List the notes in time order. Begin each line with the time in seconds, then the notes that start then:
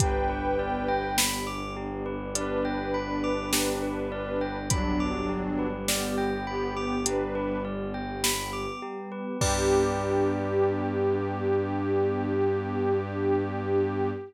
0.00 G1 B3 D4 G4 B4 G5, kick, closed hi-hat
0.29 B4
0.59 D5
0.88 G5
1.18 B5, snare
1.47 D6
1.76 G4
2.06 B4
2.35 D4 B4 D5, closed hi-hat
2.65 G5
2.94 B5
3.24 D6
3.53 G4, snare
3.82 B4
4.12 D5
4.41 G5
4.70 F#3 G3 B3 D4 G4 B5, kick, closed hi-hat
5.00 D6
5.29 G4
5.59 B4
5.88 B3 G4 D5, snare
6.18 G5
6.47 B3 G4 B5
6.76 D6
7.06 D4 G4 B4, closed hi-hat
7.35 B4
7.65 D5
7.94 G5
8.24 B5, snare
8.53 D6
8.82 G4
9.12 B4
9.40 G2 B3 D4 G4 B4 D5, kick, crash